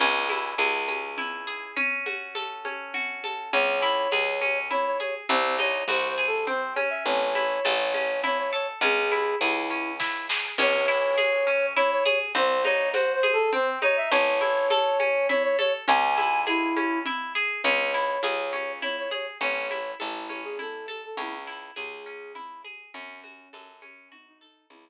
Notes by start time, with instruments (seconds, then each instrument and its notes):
0.00 electric bass (finger) C#2, orchestral harp C#4, crash, low conga
0.29 orchestral harp E4, high conga
0.58 electric bass (finger) C#2, orchestral harp G#4, tambourine, high conga
0.88 orchestral harp C#4, high conga
1.18 orchestral harp E4, low conga
1.47 orchestral harp G#4
1.76 orchestral harp C#4, low conga
2.06 orchestral harp F#4, high conga
2.35 orchestral harp A4, tambourine, high conga
2.65 orchestral harp C#4, high conga
2.94 orchestral harp F#4, low conga
3.24 orchestral harp A4, high conga
3.53 electric bass (finger) C#2, orchestral harp C#4, flute C#5, low conga
3.82 orchestral harp E4
4.12 electric bass (finger) C#2, orchestral harp G#4, tambourine, high conga
4.41 orchestral harp C#4, high conga
4.71 orchestral harp E4, flute C#5, low conga
4.86 flute C#5
5.00 orchestral harp G#4, flute C#5, high conga
5.29 electric bass (finger) C2, orchestral harp C4, flute C5, low conga
5.58 orchestral harp D#4, flute C#5, high conga
5.88 electric bass (finger) C2, orchestral harp F#4, flute C5, tambourine, high conga
6.08 flute C5
6.18 orchestral harp G#4
6.27 flute A4
6.47 orchestral harp C4, flute C5, low conga
6.75 orchestral harp C#4, flute C#5, high conga
6.90 flute E5
7.06 electric bass (finger) A1, flute C#5, low conga
7.35 orchestral harp E4, high conga
7.65 electric bass (finger) A1, orchestral harp A4, tambourine, high conga
7.94 orchestral harp C#4, high conga
8.24 orchestral harp E4, flute C#5, low conga
8.38 flute C#5
8.53 orchestral harp A4, flute C#5
8.81 electric bass (finger) C#2, orchestral harp C#4, flute G#4, low conga
9.12 orchestral harp E4, high conga
9.40 electric bass (finger) C#2, flute E4, orchestral harp G#4, tambourine, high conga
9.70 orchestral harp C#4
10.00 orchestral harp E4, kick, snare
10.29 orchestral harp G#4, snare
10.58 electric bass (finger) C#2, orchestral harp C#4, flute C#5, crash, low conga
10.88 orchestral harp E4
11.18 orchestral harp G#4, tambourine, high conga
11.47 orchestral harp C#4
11.76 orchestral harp E4, flute C#5, low conga
11.92 flute C#5
12.05 orchestral harp G#4, flute C#5, high conga
12.35 electric bass (finger) C2, orchestral harp C4, flute C5, low conga
12.65 orchestral harp D#4, flute C#5, high conga
12.93 orchestral harp F#4, flute C5, tambourine, high conga
13.13 flute C5
13.23 orchestral harp G#4, high conga
13.32 flute A4
13.53 orchestral harp C4, flute C5, low conga
13.82 orchestral harp D#4, flute C#5, high conga
13.97 flute E5
14.12 electric bass (finger) A1, orchestral harp C#4, flute C#5, low conga
14.41 orchestral harp E4, high conga
14.70 orchestral harp A4, tambourine, high conga
15.00 orchestral harp C#4, high conga
15.29 orchestral harp E4, flute C#5, low conga
15.43 flute C#5
15.59 orchestral harp A4, flute C#5, high conga
15.88 electric bass (finger) C#2, orchestral harp C#4, flute G#5, low conga
16.17 orchestral harp E4, high conga
16.47 flute E4, orchestral harp G#4, tambourine, high conga
16.76 orchestral harp C#4, high conga
17.06 orchestral harp E4, low conga
17.35 orchestral harp G#4
17.63 electric bass (finger) C#2, orchestral harp C#4, flute C#5, low conga
17.94 orchestral harp E4
18.23 electric bass (finger) C#2, orchestral harp G#4, tambourine, high conga
18.53 orchestral harp C#4, high conga
18.82 orchestral harp E4, flute C#5, low conga
18.99 flute C#5
19.11 orchestral harp G#4, flute C#5, high conga
19.41 electric bass (finger) A1, orchestral harp C#4, flute C#5, low conga
19.71 orchestral harp E4, high conga
19.99 electric bass (finger) A1, flute E4, orchestral harp A4, tambourine, high conga
20.29 orchestral harp C#4, high conga
20.44 flute G#4
20.59 orchestral harp E4, flute A4, low conga
20.87 flute A4, orchestral harp A4, high conga
21.05 flute A4
21.17 electric bass (finger) C#2, orchestral harp C#4, flute E4, low conga
21.47 orchestral harp E4
21.76 electric bass (finger) C#2, flute G#4, orchestral harp G#4, tambourine, high conga
22.06 orchestral harp C#4
22.35 orchestral harp E4, low conga
22.64 orchestral harp G#4, high conga
22.94 electric bass (finger) F#2, orchestral harp C#4, flute C#4, low conga
23.24 orchestral harp F#4, high conga
23.53 electric bass (finger) F#2, orchestral harp A4, tambourine, high conga
23.82 orchestral harp C#4, flute C#4, high conga
24.11 flute D#4, orchestral harp F#4, low conga
24.28 flute D#4
24.41 flute D#4, orchestral harp A4
24.70 electric bass (finger) C#2, flute E4, low conga